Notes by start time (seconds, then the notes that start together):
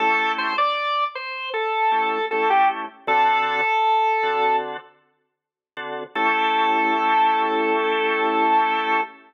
0.00 A3 C#4 E4 G4 A4
0.38 C5
0.58 D5
1.15 C5
1.54 A4
1.91 A3 C#4 E4 G4
2.31 A3 C#4 E4 G4 A4
2.50 G4
3.07 D3 C4 F#4 A4
4.23 D3 C4 F#4 A4
5.77 D3 C4 F#4 A4
6.15 A3 C#4 E4 G4 A4